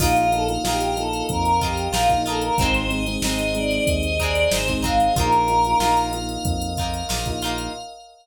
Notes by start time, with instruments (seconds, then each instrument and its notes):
0.00 synth bass 1 A#1, electric piano 1 A#3 D#4 F4, pizzicato strings A#3 D#4 F4, choir aahs F4, pad 5 (bowed) A#4 D#5 F5, kick, crash
0.16 choir aahs F4, closed hi-hat
0.32 electric piano 1 A#3 D#4 F4, choir aahs A4, closed hi-hat
0.48 electric piano 1 A#3 D#4 F4, closed hi-hat
0.63 synth bass 1 A#1, electric piano 1 A#3 D#4 F4, pizzicato strings D#4 F4, choir aahs G4, snare
0.68 pizzicato strings A#3
0.81 closed hi-hat
0.96 electric piano 1 A#3 D#4 F4, choir aahs A4, closed hi-hat
1.13 closed hi-hat
1.29 synth bass 1 F2, choir aahs A#4, kick, closed hi-hat
1.45 closed hi-hat
1.61 pizzicato strings A#3 D#4 F4, choir aahs G4, kick, closed hi-hat
1.77 closed hi-hat
1.92 synth bass 1 A#1, pizzicato strings A#3 D#4 F4, choir aahs F4, snare
2.09 electric piano 1 A#3 D#4 F4, kick, closed hi-hat
2.26 pizzicato strings A#3 D#4 F4, choir aahs A4, closed hi-hat
2.41 choir aahs A#4, closed hi-hat
2.58 synth bass 1 G#1, electric piano 1 G#3 C4 D#4, pizzicato strings C4 D#4, pad 5 (bowed) G#4 C5 D#5, choir aahs C5, kick, closed hi-hat
2.62 pizzicato strings G#3
2.74 choir aahs C5, closed hi-hat
2.89 electric piano 1 G#3 C4 D#4, choir aahs D#5, closed hi-hat
3.06 electric piano 1 G#3 C4 D#4, closed hi-hat
3.21 synth bass 1 G#1, electric piano 1 G#3 C4 D#4, pizzicato strings C4 D#4, choir aahs D#5, snare
3.26 pizzicato strings G#3
3.39 closed hi-hat
3.55 electric piano 1 G#3 C4 D#4, choir aahs D5, closed hi-hat
3.71 closed hi-hat
3.87 synth bass 1 D#2, choir aahs D#5, kick, closed hi-hat
4.03 closed hi-hat
4.19 pizzicato strings G#3 C4 D#4, choir aahs D5, kick, closed hi-hat
4.35 closed hi-hat
4.51 synth bass 1 G#1, pizzicato strings G#3 C4 D#4, choir aahs C5, snare
4.68 electric piano 1 G#3 C4 D#4, kick, closed hi-hat
4.82 pizzicato strings G#3 C4 D#4, choir aahs F5, kick, closed hi-hat
4.99 choir aahs F5, closed hi-hat
5.16 synth bass 1 A#1, electric piano 1 A#3 D#4 F4, pizzicato strings A#3 D#4 F4, pad 5 (bowed) A#4 D#5 F5, choir aahs A#4, kick, closed hi-hat
5.33 closed hi-hat
5.48 electric piano 1 A#3 D#4 F4, closed hi-hat
5.65 electric piano 1 A#3 D#4 F4, closed hi-hat
5.79 synth bass 1 A#1, electric piano 1 A#3 D#4 F4, pizzicato strings A#3 D#4 F4, snare
5.97 closed hi-hat
6.13 electric piano 1 A#3 D#4 F4, closed hi-hat
6.29 closed hi-hat
6.44 synth bass 1 F2, kick, closed hi-hat
6.62 closed hi-hat
6.77 pizzicato strings A#3 D#4 F4, kick, closed hi-hat
6.94 closed hi-hat
7.09 synth bass 1 A#1, pizzicato strings A#3 D#4 F4, snare
7.25 electric piano 1 A#3 D#4 F4, kick, closed hi-hat
7.42 pizzicato strings A#3 D#4 F4, closed hi-hat
7.58 closed hi-hat